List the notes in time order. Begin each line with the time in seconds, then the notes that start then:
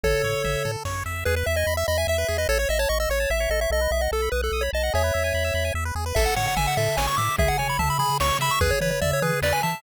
0.04 A1 A4 C#5, kick, floor tom
0.24 A2 C#5, floor tom
0.44 A1 E5, floor tom
0.65 A2 A4, floor tom
0.85 F#2 C#5, kick, snare
1.06 F2 E5
1.25 E2 G#4 B4
1.36 B4
1.46 E2 E5
1.56 D#5 G#5
1.67 E2 B5
1.77 E5 E6
1.87 E2 D#5 B5
1.98 E5 G#5
2.07 E2 E5
2.18 B4
2.28 E2 G#4
2.38 B4 D#5
2.49 A1 A4 C#5
2.59 C#5
2.69 A1 D#5 E5
2.79 C#5 A5
2.89 A1 D#5 C#6
3.00 D#5 E6
3.09 A1 C#5 C#6
3.20 A5
3.30 A1 E5
3.40 C#5
3.50 A1 A4 D#5
3.61 C#5 E5
3.70 B1 A4 D#5
3.81 B4
3.91 B1 D#5 E5
4.01 D#5 F#5
4.12 B1 A4 A5
4.22 B5
4.32 B1 B4 D#6
4.42 A4 F#6
4.52 B1 D#6
4.61 C#5 B5
4.73 B1 D#5 A5
4.83 F#5
4.93 E2 G#4 C#5 E5
5.04 B4
5.14 E2 E5
5.24 G#5
5.34 E2 B5
5.44 E6
5.54 E2 B5
5.65 G#5
5.74 E2 E5
5.85 B4
5.95 E2 G#4
6.06 B4
6.15 A1 A4 E5, kick, crash
6.26 F#5
6.36 A2 C#5 F#5, floor tom
6.48 F#5
6.56 A1 E5 G#5, floor tom
6.67 F#5
6.77 A2 A4 E5, floor tom
6.97 A1 C#5 G#5, snare
7.07 C#6
7.17 A2 E5 D6, floor tom
7.38 C#2 G#4 E5, kick, floor tom
7.48 F#5
7.58 C#3 C#5 G#5, floor tom
7.69 B5
7.79 C#2 E5 A5, floor tom
7.90 B5
7.99 C#3 G#4 B5, floor tom
8.20 C#2 C#5 C#6, snare
8.39 C#3 E5 B5, floor tom
8.51 C#6
8.61 E2 G#4 B4, kick, floor tom
8.71 C#5
8.81 E3 B4 C#5, floor tom
8.91 C#5
9.01 E2 D5 E5, floor tom
9.13 C#5
9.22 E3 G#4 B4, floor tom
9.42 E2 B4 D5, snare
9.53 G#5
9.63 E3 E5 A5, floor tom